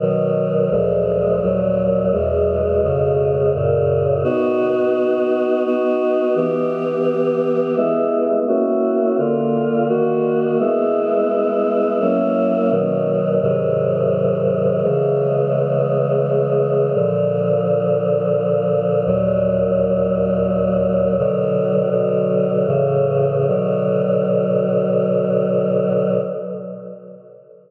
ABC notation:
X:1
M:3/4
L:1/8
Q:1/4=85
K:B
V:1 name="Choir Aahs"
[B,,D,F,]2 [=D,,A,,^E,G,]2 [^D,,A,,F,]2 | [E,,B,,G,]2 [^E,,B,,C,G,]2 [F,,A,,C,]2 | [B,DF]4 [B,DF]2 | [E,B,=G]4 [^G,B,E]2 |
[A,CEF]2 [=D,A,^E]2 [^D,A,F]2 | [G,B,E]4 [F,A,CE]2 | [B,,D,F,]2 [G,,^B,,D,F,]4 | [C,E,G,]6 |
[A,,=D,^E,]6 | [D,,A,,F,]6 | [K:Bm] "^rit." [B,,D,F,]2 [B,,D,F,]2 [A,,C,E,]2 | [B,,D,F,]6 |]